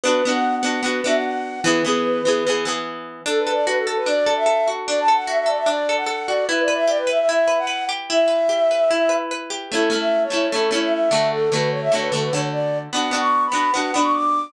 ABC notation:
X:1
M:4/4
L:1/16
Q:1/4=149
K:A
V:1 name="Flute"
(3B4 f4 f4 B2 e f f4 | B10 z6 | [K:D] (3A2 B2 d2 B A A B d3 e3 z2 | (3d2 a2 f2 e e d e d3 f3 d2 |
(3B2 d2 e2 d B e e e3 f3 z2 | e12 z4 | [K:A] (3A4 e4 c4 A2 c e e4 | A2 B2 c e c B A B c z d3 z |
(3f4 c'4 b4 f2 b c' d'4 |]
V:2 name="Acoustic Guitar (steel)"
[B,DF]2 [B,DF]4 [B,DF]2 [B,DF]2 [B,DF]6 | [E,B,G]2 [E,B,G]4 [E,B,G]2 [E,B,G]2 [E,B,G]6 | [K:D] D2 A2 F2 A2 D2 A2 A2 F2 | D2 A2 F2 A2 D2 A2 A2 F2 |
E2 B2 G2 B2 E2 B2 B2 G2 | E2 B2 G2 B2 E2 B2 B2 G2 | [K:A] [A,CE]2 [A,CE]4 [A,CE]2 [A,CE]2 [A,CE]4 [D,A,F]2- | [D,A,F]2 [D,A,F]4 [D,A,F]2 [D,A,F]2 [D,A,F]6 |
[B,DF]2 [B,DF]4 [B,DF]2 [B,DF]2 [B,DF]6 |]